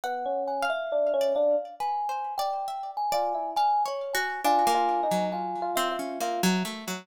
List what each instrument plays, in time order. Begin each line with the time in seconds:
0.04 electric piano 1 B3, kalimba F#5, orchestral harp F#5
0.26 electric piano 1 C#4
0.47 kalimba G#5
0.63 orchestral harp F5
0.70 kalimba E5
0.92 electric piano 1 D4
1.14 electric piano 1 C#4
1.21 orchestral harp D5
1.35 electric piano 1 D4, kalimba F5
1.80 orchestral harp B4, kalimba G#5
2.09 orchestral harp C5
2.38 orchestral harp D5, kalimba G5
2.68 orchestral harp E5
2.97 kalimba G#5
3.12 electric piano 1 F4, orchestral harp D5
3.34 electric piano 1 E4
3.56 orchestral harp F5, kalimba G#5
3.85 orchestral harp C#5, kalimba C#5
4.13 orchestral harp F#4, kalimba G#5
4.44 orchestral harp D4, electric piano 1 F4, kalimba G#5
4.67 orchestral harp A#3
4.74 electric piano 1 F4
5.03 electric piano 1 D#4
5.11 orchestral harp F#3
5.32 electric piano 1 F4, kalimba G#5
5.62 electric piano 1 F4
5.76 orchestral harp C4, kalimba E5
5.92 electric piano 1 F4
5.99 orchestral harp C#4
6.20 orchestral harp A#3, electric piano 1 F4
6.43 orchestral harp F#3
6.65 orchestral harp A3
6.88 orchestral harp F#3